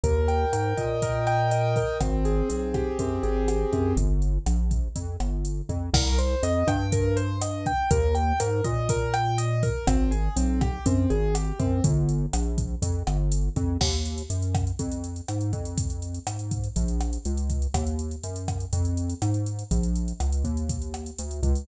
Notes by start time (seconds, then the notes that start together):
0.03 D#2 A#4, kick, closed hi-hat
0.28 G5, closed hi-hat
0.53 G#2 A#4, cross-stick, closed hi-hat
0.77 A#2 D#5, kick, closed hi-hat
1.02 A#4, kick, closed hi-hat
1.27 G5, cross-stick, closed hi-hat
1.51 D#5, closed hi-hat
1.76 A#4, kick, open hi-hat
2.01 G#1 C4, kick, cross-stick, closed hi-hat
2.25 G#4, closed hi-hat
2.49 B1 C4, closed hi-hat
2.74 G4, kick, cross-stick, closed hi-hat
2.99 F#2 C4, kick, closed hi-hat
3.23 G#1 G#4, closed hi-hat
3.48 G4, cross-stick, closed hi-hat
3.73 F#2 C4, kick, closed hi-hat
3.97 G1, kick, closed hi-hat
4.22 closed hi-hat
4.46 A#1, cross-stick, closed hi-hat
4.71 kick, closed hi-hat
4.96 F2, kick, closed hi-hat
5.20 G1, cross-stick, closed hi-hat
5.45 closed hi-hat
5.69 F2, kick, closed hi-hat
5.93 C2 A#4, kick, cross-stick, crash
6.18 C5, closed hi-hat
6.43 F2 D#5, closed hi-hat
6.67 G2 G5, kick, cross-stick, closed hi-hat
6.92 A#4, kick, closed hi-hat
7.16 C5, closed hi-hat
7.41 D#5, cross-stick, closed hi-hat
7.66 G5, kick, closed hi-hat
7.91 D#2 A#4, kick, closed hi-hat
8.15 G5, closed hi-hat
8.40 G#2 A#4, cross-stick, closed hi-hat
8.64 A#2 D#5, kick, closed hi-hat
8.89 A#4, kick, closed hi-hat
9.14 G5, cross-stick, closed hi-hat
9.38 D#5, closed hi-hat
9.63 A#4, kick, open hi-hat
9.87 G#1 C4, kick, cross-stick, closed hi-hat
10.11 G#4, closed hi-hat
10.36 B1 C4, closed hi-hat
10.61 G4, kick, cross-stick, closed hi-hat
10.86 F#2 C4, kick, closed hi-hat
11.10 G#1 G#4, closed hi-hat
11.35 G4, cross-stick, closed hi-hat
11.59 F#2 C4, kick, closed hi-hat
11.84 G1, kick, closed hi-hat
12.09 closed hi-hat
12.33 A#1, cross-stick, closed hi-hat
12.58 kick, closed hi-hat
12.82 F2, kick, closed hi-hat
13.07 G1, cross-stick, closed hi-hat
13.32 closed hi-hat
13.56 F2, kick, closed hi-hat
13.81 D#2, kick, cross-stick, crash
13.93 closed hi-hat
14.05 closed hi-hat
14.18 closed hi-hat
14.30 F#2, closed hi-hat
14.42 closed hi-hat
14.55 kick, cross-stick, closed hi-hat
14.67 closed hi-hat
14.79 F2, kick, closed hi-hat
14.91 closed hi-hat
15.04 closed hi-hat
15.16 closed hi-hat
15.28 G#2, cross-stick, closed hi-hat
15.41 closed hi-hat
15.53 F2, kick, closed hi-hat
15.65 closed hi-hat
15.78 kick, closed hi-hat
15.90 closed hi-hat
16.02 closed hi-hat
16.14 closed hi-hat
16.27 G#2, cross-stick, closed hi-hat
16.39 closed hi-hat
16.51 kick, closed hi-hat
16.64 closed hi-hat
16.76 A#1, kick, closed hi-hat
16.88 closed hi-hat
17.01 cross-stick, closed hi-hat
17.13 closed hi-hat
17.25 C#2, closed hi-hat
17.37 closed hi-hat
17.50 kick, closed hi-hat
17.62 closed hi-hat
17.74 D#2, kick, cross-stick, closed hi-hat
17.87 closed hi-hat
17.99 closed hi-hat
18.11 closed hi-hat
18.23 F#2, closed hi-hat
18.36 closed hi-hat
18.48 kick, cross-stick, closed hi-hat
18.60 closed hi-hat
18.73 F2, kick, closed hi-hat
18.85 closed hi-hat
18.97 closed hi-hat
19.10 closed hi-hat
19.22 G#2, cross-stick, closed hi-hat
19.34 closed hi-hat
19.46 closed hi-hat
19.59 closed hi-hat
19.71 A#1, kick, closed hi-hat
19.83 closed hi-hat
19.95 closed hi-hat
20.08 closed hi-hat
20.20 C#2, cross-stick, closed hi-hat
20.32 closed hi-hat
20.44 D#2, kick, closed hi-hat
20.57 closed hi-hat
20.69 kick, closed hi-hat
20.82 closed hi-hat
20.94 cross-stick, closed hi-hat
21.06 closed hi-hat
21.19 D2, closed hi-hat
21.31 closed hi-hat
21.43 C#2, kick, closed hi-hat
21.55 open hi-hat